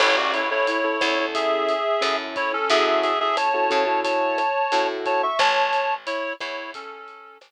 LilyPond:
<<
  \new Staff \with { instrumentName = "Clarinet" } { \time 4/4 \key a \major \tempo 4 = 89 <e' cis''>16 <fis' d''>16 <e' cis''>16 <e' cis''>16 <e' cis''>4 <gis' e''>4. <e' cis''>16 <cis' a'>16 | <gis' e''>16 <gis' e''>16 <gis' e''>16 <gis' e''>16 <cis'' a''>4 <cis'' a''>4. <cis'' a''>16 <e'' cis'''>16 | <cis'' a''>4 <e' cis''>8 <e' cis''>8 <cis' a'>4 r4 | }
  \new Staff \with { instrumentName = "Acoustic Grand Piano" } { \time 4/4 \key a \major <cis' e' a'>8. <cis' e' a'>8 <cis' e' a'>16 <cis' e' a'>16 <cis' e' a'>4~ <cis' e' a'>16 <cis' e' a'>4 | <cis' e' fis' a'>8. <cis' e' fis' a'>8 <cis' e' fis' a'>16 <cis' e' fis' a'>16 <cis' e' fis' a'>4~ <cis' e' fis' a'>16 <cis' e' fis' a'>4 | r1 | }
  \new Staff \with { instrumentName = "Electric Bass (finger)" } { \clef bass \time 4/4 \key a \major a,,4. e,4. fis,4 | fis,4. cis4. a,4 | a,,4. e,4. a,,4 | }
  \new DrumStaff \with { instrumentName = "Drums" } \drummode { \time 4/4 <cymc bd ss>8 hh8 hh8 <hh bd ss>8 <hh bd>8 hh8 <hh ss>8 <hh bd>8 | <hh bd>8 hh8 <hh ss>8 <hh bd>8 <hh bd>8 <hh ss>8 hh8 <hh bd>8 | <hh bd ss>8 hh8 hh8 <hh bd ss>8 <hh bd>8 hh8 <hh ss>4 | }
>>